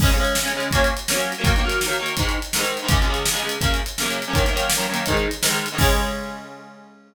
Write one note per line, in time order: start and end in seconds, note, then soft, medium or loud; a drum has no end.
0.00 0.10 C#3 medium
0.00 0.10 G#3 medium
0.00 0.10 C#4 loud
0.00 kick loud
0.00 crash loud
0.11 0.16 C#3 medium
0.11 0.16 G#3 medium
0.11 0.17 C#4 medium
0.11 closed hi-hat medium
0.18 0.37 C#3 medium
0.18 0.37 G#3 medium
0.18 0.37 C#4 medium
0.25 closed hi-hat medium
0.35 snare loud
0.43 0.52 C#3 medium
0.43 0.52 G#3 medium
0.43 0.52 C#4 medium
0.48 closed hi-hat medium
0.54 0.68 C#3 medium
0.54 0.68 G#3 medium
0.54 0.68 C#4 medium
0.60 closed hi-hat medium
0.71 0.92 F#3 medium
0.71 0.92 A#3 medium
0.71 kick medium
0.71 closed hi-hat loud
0.75 0.92 C#4 loud
0.84 closed hi-hat medium
0.97 closed hi-hat medium
1.08 1.13 F#3 medium
1.08 1.13 A#3 medium
1.08 1.14 C#4 medium
1.08 snare loud
1.14 1.33 F#3 medium
1.14 1.33 A#3 medium
1.14 1.33 C#4 medium
1.20 closed hi-hat medium
1.32 closed hi-hat medium
1.38 1.43 F#3 medium
1.38 1.43 A#3 medium
1.38 1.44 C#4 medium
1.44 1.53 D#3 medium
1.44 1.53 F#3 loud
1.44 1.53 A#3 medium
1.44 kick loud
1.44 closed hi-hat loud
1.56 1.62 D#3 medium
1.56 1.62 F#3 medium
1.56 1.63 A#3 medium
1.56 closed hi-hat medium
1.64 1.83 D#3 medium
1.64 1.83 F#3 medium
1.64 1.83 A#3 medium
1.69 closed hi-hat medium
1.81 snare loud
1.86 1.96 D#3 medium
1.86 1.96 F#3 medium
1.86 1.96 A#3 medium
1.93 closed hi-hat medium
1.99 2.14 D#3 medium
1.99 2.14 F#3 medium
1.99 2.14 A#3 medium
2.06 closed hi-hat medium
2.17 2.37 G#2 medium
2.17 2.37 D#3 medium
2.17 2.37 G#3 medium
2.17 kick medium
2.17 closed hi-hat loud
2.29 closed hi-hat medium
2.42 closed hi-hat medium
2.53 2.59 G#2 medium
2.53 2.59 D#3 medium
2.53 2.60 G#3 medium
2.53 snare loud
2.59 2.78 G#2 medium
2.59 2.78 D#3 medium
2.59 2.78 G#3 medium
2.65 closed hi-hat medium
2.77 closed hi-hat medium
2.82 2.87 G#2 medium
2.82 2.87 D#3 medium
2.82 2.88 G#3 medium
2.88 2.98 C#2 medium
2.88 2.98 C#3 medium
2.88 2.98 G#3 medium
2.88 kick loud
2.88 closed hi-hat loud
3.01 3.06 C#2 medium
3.01 3.06 C#3 medium
3.01 3.06 G#3 medium
3.01 closed hi-hat medium
3.07 3.27 C#2 medium
3.07 3.27 C#3 medium
3.07 3.27 G#3 medium
3.14 closed hi-hat medium
3.26 snare loud
3.32 3.41 C#2 medium
3.32 3.41 C#3 medium
3.32 3.41 G#3 medium
3.37 closed hi-hat medium
3.42 3.56 C#2 medium
3.42 3.56 C#3 medium
3.42 3.56 G#3 medium
3.49 closed hi-hat medium
3.61 3.80 F#2 medium
3.61 3.80 C#3 medium
3.61 3.80 A#3 medium
3.61 kick loud
3.61 closed hi-hat loud
3.74 closed hi-hat medium
3.86 closed hi-hat medium
3.98 4.02 F#2 medium
3.98 4.03 C#3 medium
3.98 4.04 A#3 medium
3.98 snare loud
4.03 4.22 F#2 medium
4.03 4.22 C#3 medium
4.03 4.22 A#3 medium
4.10 closed hi-hat medium
4.22 closed hi-hat medium
4.28 4.32 F#2 medium
4.28 4.32 C#3 medium
4.28 4.33 A#3 medium
4.33 4.43 F#2 medium
4.33 4.43 D#3 loud
4.33 4.43 A#3 medium
4.33 kick loud
4.33 closed hi-hat loud
4.44 4.49 F#2 medium
4.44 4.49 D#3 medium
4.44 4.50 A#3 medium
4.44 closed hi-hat medium
4.53 4.72 F#2 medium
4.53 4.72 D#3 medium
4.53 4.72 A#3 medium
4.53 closed hi-hat loud
4.70 snare loud
4.77 4.86 F#2 medium
4.77 4.86 D#3 medium
4.77 4.86 A#3 medium
4.81 closed hi-hat medium
4.89 5.04 F#2 medium
4.89 5.04 D#3 medium
4.89 5.04 A#3 medium
4.94 closed hi-hat medium
5.06 5.26 G#2 medium
5.06 5.26 D#3 medium
5.06 kick medium
5.06 closed hi-hat loud
5.10 5.26 G#3 medium
5.17 closed hi-hat medium
5.31 closed hi-hat medium
5.42 5.46 G#2 medium
5.42 5.47 D#3 medium
5.42 5.48 G#3 medium
5.42 snare loud
5.47 5.66 G#2 medium
5.47 5.66 D#3 medium
5.47 5.66 G#3 medium
5.54 closed hi-hat medium
5.66 closed hi-hat medium
5.72 5.77 G#2 medium
5.72 5.77 D#3 medium
5.72 5.78 G#3 medium
5.78 7.14 C#3 loud
5.78 7.14 G#3 loud
5.78 7.14 C#4 loud
5.78 kick loud
5.78 crash loud